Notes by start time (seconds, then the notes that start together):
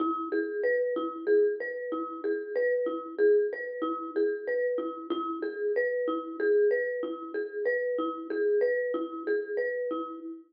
0.00 E4
0.32 G#4
0.64 B4
0.96 E4
1.27 G#4
1.60 B4
1.92 E4
2.24 G#4
2.56 B4
2.86 E4
3.18 G#4
3.53 B4
3.82 E4
4.16 G#4
4.47 B4
4.78 E4
5.10 E4
5.42 G#4
5.76 B4
6.08 E4
6.40 G#4
6.71 B4
7.03 E4
7.34 G#4
7.65 B4
7.98 E4
8.30 G#4
8.61 B4
8.94 E4
9.27 G#4
9.57 B4
9.91 E4